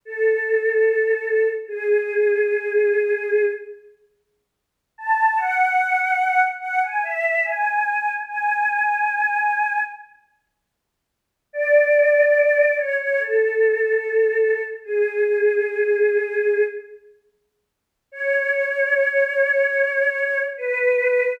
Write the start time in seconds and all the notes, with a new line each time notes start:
0.05 A4
1.68 G#4
4.98 A5
5.37 F#5
6.60 F#5
6.83 G#5
7.03 E5
7.44 G#5
8.26 G#5
11.53 D5
12.77 C#5
12.99 C#5
13.19 A4
14.84 G#4
18.11 C#5
20.57 B4